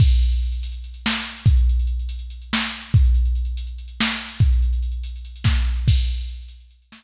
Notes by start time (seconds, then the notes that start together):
0.00 kick, crash
0.11 closed hi-hat
0.21 closed hi-hat
0.33 closed hi-hat
0.43 closed hi-hat
0.52 closed hi-hat
0.63 closed hi-hat
0.72 closed hi-hat
0.84 closed hi-hat
0.94 closed hi-hat
1.06 snare
1.14 closed hi-hat
1.25 closed hi-hat
1.36 closed hi-hat
1.46 kick, closed hi-hat
1.57 closed hi-hat
1.69 closed hi-hat
1.79 closed hi-hat
1.87 closed hi-hat
1.99 closed hi-hat
2.09 closed hi-hat
2.19 closed hi-hat
2.30 closed hi-hat
2.42 closed hi-hat
2.53 snare
2.63 closed hi-hat
2.74 closed hi-hat
2.82 closed hi-hat
2.94 kick, closed hi-hat
3.04 closed hi-hat
3.15 closed hi-hat
3.25 closed hi-hat
3.35 closed hi-hat
3.45 closed hi-hat
3.57 closed hi-hat
3.67 closed hi-hat
3.78 closed hi-hat
3.88 closed hi-hat
4.00 snare
4.10 closed hi-hat
4.21 closed hi-hat
4.29 open hi-hat
4.39 kick, closed hi-hat
4.53 closed hi-hat
4.62 closed hi-hat
4.73 closed hi-hat
4.83 closed hi-hat
4.92 closed hi-hat
5.03 closed hi-hat
5.16 closed hi-hat
5.25 closed hi-hat
5.36 closed hi-hat
5.44 kick, snare
5.88 kick, crash
5.98 closed hi-hat
6.08 closed hi-hat
6.19 closed hi-hat
6.29 closed hi-hat
6.41 closed hi-hat
6.49 closed hi-hat
6.60 closed hi-hat
6.71 closed hi-hat
6.82 closed hi-hat
6.92 snare